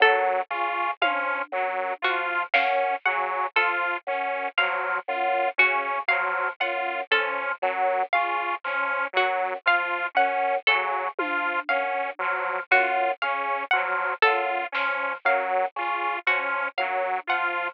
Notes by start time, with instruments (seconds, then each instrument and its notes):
0.00 drawbar organ F#2, lead 2 (sawtooth) F#3, harpsichord A4
0.50 drawbar organ C#3, lead 2 (sawtooth) F4, kick
1.01 drawbar organ F3, lead 2 (sawtooth) C#4, harpsichord F5, high tom
1.52 drawbar organ F#2, lead 2 (sawtooth) F#3
2.02 drawbar organ F3, lead 2 (sawtooth) F4, harpsichord F#4, kick
2.54 drawbar organ F#2, lead 2 (sawtooth) C#4, harpsichord F5, snare
3.05 drawbar organ C#3, lead 2 (sawtooth) F#3, harpsichord F#5
3.56 drawbar organ F3, lead 2 (sawtooth) F4, harpsichord A4
4.07 drawbar organ F#2, lead 2 (sawtooth) C#4
4.57 drawbar organ F3, lead 2 (sawtooth) F#3, harpsichord F5, snare
5.08 drawbar organ F#2, lead 2 (sawtooth) F4
5.58 drawbar organ C#3, lead 2 (sawtooth) C#4, harpsichord F#4
6.08 drawbar organ F3, lead 2 (sawtooth) F#3, harpsichord F5
6.60 drawbar organ F#2, lead 2 (sawtooth) F4, harpsichord F#5
7.11 drawbar organ F3, lead 2 (sawtooth) C#4, harpsichord A4
7.62 drawbar organ F#2, lead 2 (sawtooth) F#3, cowbell
8.13 drawbar organ C#3, lead 2 (sawtooth) F4, harpsichord F5
8.64 drawbar organ F3, lead 2 (sawtooth) C#4, clap
9.13 drawbar organ F#2, lead 2 (sawtooth) F#3, harpsichord F#4
9.66 drawbar organ F3, lead 2 (sawtooth) F4, harpsichord F5
10.15 drawbar organ F#2, lead 2 (sawtooth) C#4, harpsichord F#5
10.67 drawbar organ C#3, lead 2 (sawtooth) F#3, harpsichord A4, kick
11.19 drawbar organ F3, lead 2 (sawtooth) F4, high tom
11.69 drawbar organ F#2, lead 2 (sawtooth) C#4, harpsichord F5
12.19 drawbar organ F3, lead 2 (sawtooth) F#3
12.71 drawbar organ F#2, lead 2 (sawtooth) F4, harpsichord F#4
13.22 drawbar organ C#3, lead 2 (sawtooth) C#4, harpsichord F5, closed hi-hat
13.71 drawbar organ F3, lead 2 (sawtooth) F#3, harpsichord F#5
14.22 drawbar organ F#2, lead 2 (sawtooth) F4, harpsichord A4
14.72 drawbar organ F3, lead 2 (sawtooth) C#4, snare
15.25 drawbar organ F#2, lead 2 (sawtooth) F#3, harpsichord F5
15.76 drawbar organ C#3, lead 2 (sawtooth) F4, cowbell
16.26 drawbar organ F3, lead 2 (sawtooth) C#4, harpsichord F#4
16.78 drawbar organ F#2, lead 2 (sawtooth) F#3, harpsichord F5, high tom
17.27 drawbar organ F3, lead 2 (sawtooth) F4, harpsichord F#5